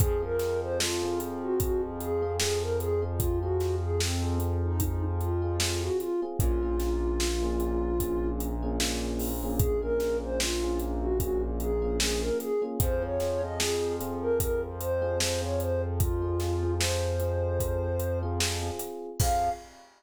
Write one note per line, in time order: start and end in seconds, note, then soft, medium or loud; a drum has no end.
0.00 5.90 F2 loud
0.00 0.18 C4 medium
0.00 0.18 F4 medium
0.00 0.21 G#4 medium
0.00 0.18 G#4 loud
0.00 kick loud
0.00 closed hi-hat loud
0.22 0.85 C4 medium
0.22 0.85 F4 medium
0.22 0.85 G#4 medium
0.22 0.60 A#4 medium
0.39 snare medium
0.39 closed hi-hat medium
0.61 0.78 C5 medium
0.80 1.19 F4 medium
0.80 snare loud
1.03 1.50 C4 medium
1.03 1.50 F4 loud
1.03 1.50 G#4 medium
1.20 closed hi-hat medium
1.42 1.59 F#4 medium
1.60 2.09 C4 medium
1.60 2.09 F4 medium
1.60 1.82 F#4 medium
1.60 2.09 G#4 medium
1.60 kick medium
1.60 closed hi-hat loud
2.00 2.33 G#4 medium
2.00 closed hi-hat medium
2.22 2.37 C4 medium
2.22 2.37 F4 medium
2.22 2.37 G#4 medium
2.39 2.89 C4 medium
2.39 2.89 F4 medium
2.39 2.60 G#4 medium
2.39 2.89 G#4 medium
2.39 snare loud
2.61 2.78 A#4 medium
2.80 3.02 G#4 medium
2.80 closed hi-hat medium
3.02 3.33 C4 medium
3.02 3.33 F4 medium
3.02 3.33 G#4 medium
3.18 3.39 F4 medium
3.18 kick loud
3.18 closed hi-hat loud
3.41 4.05 C4 medium
3.41 4.05 F4 medium
3.41 3.75 F#4 medium
3.41 4.05 G#4 medium
3.60 snare medium
3.60 closed hi-hat medium
3.82 3.99 G#4 medium
4.00 4.37 C4 medium
4.00 snare loud
4.22 4.69 C4 medium
4.22 4.69 F4 medium
4.22 4.69 G#4 medium
4.40 closed hi-hat medium
4.64 4.81 D#4 medium
4.80 5.29 C4 medium
4.80 5.03 D#4 medium
4.80 5.29 F4 medium
4.80 5.29 G#4 medium
4.80 kick medium
4.80 closed hi-hat loud
5.20 5.57 F4 medium
5.20 closed hi-hat medium
5.42 5.56 C4 medium
5.42 5.56 F4 medium
5.42 5.56 G#4 medium
5.60 6.10 C4 medium
5.60 5.81 F4 medium
5.60 6.10 F4 medium
5.60 6.10 G#4 medium
5.60 snare loud
5.81 5.98 F#4 medium
6.00 6.21 F4 medium
6.00 closed hi-hat medium
6.22 6.37 C4 medium
6.22 6.37 F4 medium
6.22 6.37 G#4 medium
6.39 12.31 A#1 loud
6.39 6.58 A#3 medium
6.39 6.58 C#4 loud
6.39 6.58 F4 loud
6.39 8.28 F4 loud
6.39 6.58 G#4 medium
6.39 kick loud
6.39 closed hi-hat loud
6.62 7.25 A#3 medium
6.62 7.25 C#4 medium
6.62 7.25 F4 medium
6.62 7.25 G#4 medium
6.80 snare medium
6.80 closed hi-hat medium
7.20 snare loud
7.42 7.90 A#3 medium
7.42 7.90 C#4 medium
7.42 7.90 F4 medium
7.42 7.90 G#4 medium
7.60 closed hi-hat medium
8.00 8.49 A#3 medium
8.00 8.49 C#4 medium
8.00 8.49 F4 medium
8.00 8.49 G#4 medium
8.00 kick medium
8.00 closed hi-hat loud
8.40 closed hi-hat medium
8.62 8.77 A#3 medium
8.62 8.77 C#4 medium
8.62 8.77 F4 medium
8.62 8.77 G#4 medium
8.80 9.29 A#3 medium
8.80 9.29 C#4 medium
8.80 9.29 F4 loud
8.80 9.29 G#4 medium
8.80 snare loud
9.19 open hi-hat medium
9.43 9.74 A#3 medium
9.43 9.74 C#4 medium
9.43 9.74 F4 medium
9.43 9.74 G#4 medium
9.58 9.79 G#4 medium
9.58 kick loud
9.58 closed hi-hat loud
9.82 10.45 A#3 medium
9.82 10.45 C#4 medium
9.82 10.45 F4 medium
9.82 10.45 G#4 medium
9.82 10.17 A#4 medium
10.00 snare medium
10.00 closed hi-hat medium
10.23 10.40 C5 medium
10.39 10.77 F4 medium
10.39 snare loud
10.62 11.09 A#3 medium
10.62 11.09 C#4 medium
10.62 11.09 F4 medium
10.62 11.09 G#4 medium
10.79 closed hi-hat medium
11.01 11.18 F#4 medium
11.20 11.69 A#3 medium
11.20 11.69 C#4 medium
11.20 11.69 F4 medium
11.20 11.42 F#4 medium
11.20 11.69 G#4 medium
11.20 kick medium
11.20 closed hi-hat loud
11.60 11.96 G#4 medium
11.60 closed hi-hat medium
11.82 11.96 A#3 medium
11.82 11.96 C#4 medium
11.82 11.96 F4 medium
11.82 11.96 G#4 medium
11.99 12.49 A#3 medium
11.99 12.49 C#4 medium
11.99 12.49 F4 medium
11.99 12.20 G#4 medium
11.99 12.49 G#4 medium
11.99 snare loud
12.21 12.38 A#4 medium
12.40 12.61 G#4 medium
12.40 closed hi-hat medium
12.62 12.76 A#3 medium
12.62 12.76 C#4 medium
12.62 12.76 F4 medium
12.62 12.76 G#4 medium
12.80 18.71 F2 medium
12.80 12.98 C4 loud
12.80 12.98 F4 medium
12.80 12.98 G#4 loud
12.80 13.03 C5 medium
12.80 kick loud
12.80 closed hi-hat loud
13.02 13.16 C4 medium
13.02 13.16 F4 medium
13.02 13.16 G#4 medium
13.02 13.41 C#5 medium
13.20 13.38 C4 medium
13.20 13.38 F4 medium
13.20 13.38 G#4 medium
13.20 snare medium
13.20 closed hi-hat medium
13.42 13.56 C4 medium
13.42 13.56 F4 medium
13.42 13.56 G#4 medium
13.42 13.59 D#5 medium
13.58 13.93 C4 medium
13.58 13.93 F4 medium
13.58 13.93 G#4 medium
13.58 snare loud
14.00 14.66 C4 medium
14.00 14.66 F4 medium
14.00 14.66 G#4 medium
14.00 closed hi-hat medium
14.21 14.38 A#4 medium
14.40 14.61 A#4 medium
14.40 kick medium
14.40 closed hi-hat loud
14.80 15.19 C5 medium
14.80 closed hi-hat medium
15.02 15.16 C4 medium
15.02 15.16 F4 medium
15.02 15.16 G#4 medium
15.20 15.38 C4 medium
15.20 15.38 F4 medium
15.20 15.38 G#4 medium
15.20 15.41 C5 medium
15.20 snare loud
15.42 16.04 C4 medium
15.42 16.04 F4 medium
15.42 16.04 G#4 medium
15.42 15.60 C#5 medium
15.60 15.82 C5 medium
15.60 closed hi-hat medium
16.00 16.74 F4 medium
16.00 kick loud
16.00 closed hi-hat loud
16.22 16.36 C4 medium
16.22 16.36 F4 medium
16.22 16.36 G#4 medium
16.40 16.58 C4 medium
16.40 16.58 F4 medium
16.40 16.58 G#4 medium
16.40 snare medium
16.40 closed hi-hat medium
16.63 16.77 C4 medium
16.63 16.77 F4 medium
16.63 16.77 G#4 medium
16.80 17.13 C4 medium
16.80 17.13 F4 medium
16.80 17.13 G#4 medium
16.80 18.19 C5 medium
16.80 snare loud
17.20 17.86 C4 medium
17.20 17.86 F4 medium
17.20 17.86 G#4 medium
17.20 closed hi-hat medium
17.60 kick medium
17.60 closed hi-hat loud
18.00 closed hi-hat medium
18.23 18.37 C4 medium
18.23 18.37 F4 medium
18.23 18.37 G#4 medium
18.40 18.58 C4 medium
18.40 18.58 F4 medium
18.40 18.58 G#4 medium
18.40 snare loud
18.62 19.09 C4 medium
18.62 19.09 F4 medium
18.62 19.09 G#4 medium
18.79 closed hi-hat medium
19.20 19.50 F2 loud
19.20 19.49 C4 loud
19.20 19.49 F4 loud
19.20 19.49 G#4 loud
19.20 19.50 F5 loud
19.20 kick loud
19.20 crash loud